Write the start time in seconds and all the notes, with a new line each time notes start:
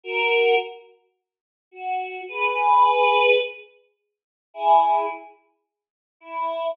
0.04 F#4 A#4
1.71 F#4
2.28 G#4 B4
4.54 E4 G#4
6.20 E4